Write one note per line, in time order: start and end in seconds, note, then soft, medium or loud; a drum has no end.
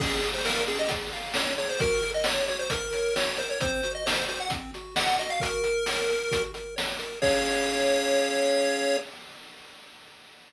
0.00 0.20 C#4 medium
0.00 0.28 G#4 medium
0.00 kick loud
0.00 crash loud
0.22 0.42 G#4 medium
0.22 closed hi-hat medium
0.34 0.45 C5 medium
0.45 0.64 A#4 medium
0.45 0.65 F5 medium
0.45 snare loud
0.67 0.88 C#4 medium
0.67 0.78 G#4 medium
0.67 closed hi-hat medium
0.79 0.90 D#5 medium
0.89 1.10 G#4 medium
0.89 kick loud
0.89 closed hi-hat loud
1.13 1.33 F5 medium
1.13 closed hi-hat medium
1.34 1.55 C#4 medium
1.34 1.54 C#5 medium
1.34 snare loud
1.58 1.78 G#4 medium
1.58 1.69 C#5 medium
1.58 closed hi-hat medium
1.69 1.80 C5 medium
1.80 2.01 F#4 medium
1.80 2.11 A#4 medium
1.80 kick loud
1.80 closed hi-hat loud
2.03 2.24 A#4 medium
2.03 closed hi-hat medium
2.14 2.25 D#5 medium
2.24 2.45 C#5 medium
2.24 snare loud
2.48 2.69 F#4 medium
2.48 2.59 C#5 medium
2.48 closed hi-hat medium
2.59 2.70 C5 medium
2.70 3.15 A#4 medium
2.70 2.91 A#4 medium
2.70 kick loud
2.70 closed hi-hat loud
2.93 3.14 C#5 medium
2.93 closed hi-hat medium
3.16 3.36 F#4 medium
3.16 3.38 C#5 medium
3.16 snare loud
3.37 3.59 A#4 medium
3.37 3.49 C5 medium
3.37 closed hi-hat medium
3.50 3.60 C#5 medium
3.60 3.81 C4 medium
3.60 3.92 C5 medium
3.60 kick loud
3.60 closed hi-hat loud
3.83 4.04 F#4 medium
3.83 closed hi-hat medium
3.95 4.05 D#5 medium
4.06 4.25 C5 medium
4.06 4.26 D#5 medium
4.06 snare loud
4.28 4.48 F#4 medium
4.28 4.39 C5 medium
4.28 closed hi-hat medium
4.40 4.51 F#5 medium
4.50 4.71 C4 medium
4.50 kick loud
4.50 closed hi-hat loud
4.74 4.95 F#4 medium
4.74 closed hi-hat medium
4.96 5.16 D#5 medium
4.96 5.17 F#5 medium
4.96 snare loud
5.19 5.40 F#4 medium
5.19 5.30 D#5 medium
5.19 closed hi-hat medium
5.30 5.41 F5 medium
5.40 5.63 F#4 medium
5.40 6.42 A#4 medium
5.40 kick loud
5.40 closed hi-hat loud
5.64 5.84 A#4 medium
5.64 closed hi-hat medium
5.86 6.07 C#5 medium
5.86 snare loud
6.09 6.29 A#4 medium
6.09 closed hi-hat medium
6.31 6.51 F#4 medium
6.31 kick loud
6.31 closed hi-hat loud
6.54 6.75 A#4 medium
6.54 closed hi-hat medium
6.76 6.97 C#5 medium
6.76 snare loud
6.99 7.19 A#4 medium
6.99 closed hi-hat medium
7.22 8.97 C#4 loud
7.22 8.97 G#4 loud
7.22 8.97 C#5 loud
7.22 8.97 F5 medium
7.22 kick loud
7.22 crash loud